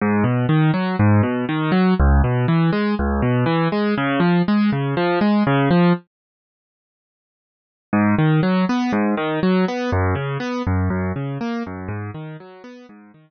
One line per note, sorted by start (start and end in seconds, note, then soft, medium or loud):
0.01 0.24 G#2 loud
0.24 0.46 B2 medium
0.49 0.71 D#3 medium
0.74 0.96 F#3 medium
0.99 1.22 G#2 loud
1.23 1.45 B2 medium
1.49 1.71 D#3 medium
1.72 1.94 F#3 medium
1.99 2.22 C#2 loud
2.24 2.46 B2 medium
2.48 2.71 E3 medium
2.73 2.95 G#3 medium
2.99 3.21 C#2 loud
3.22 3.45 B2 medium
3.46 3.68 E3 loud
3.72 3.95 G#3 medium
3.98 4.20 C#3 loud
4.20 4.42 F3 medium
4.48 4.70 G#3 medium
4.72 4.95 C#3 medium
4.97 5.19 F3 loud
5.21 5.43 G#3 medium
5.47 5.69 C#3 loud
5.71 5.93 F3 medium
7.93 8.15 G#2 loud
8.18 8.41 D#3 medium
8.43 8.65 F#3 medium
8.69 8.92 B3 medium
8.92 9.15 G#2 loud
9.17 9.40 D#3 medium
9.43 9.65 F#3 medium
9.68 9.91 B3 medium
9.92 10.15 F#2 loud
10.15 10.38 C#3 medium
10.40 10.62 B3 medium
10.67 10.89 F#2 loud
10.90 11.12 F#2 loud
11.16 11.38 C#3 medium
11.41 11.63 A#3 medium
11.66 11.89 F#2 loud
11.88 12.11 G#2 loud
12.14 12.37 D#3 medium
12.40 12.63 F#3 medium
12.64 12.86 B3 medium
12.89 13.12 G#2 loud
13.14 13.30 D#3 medium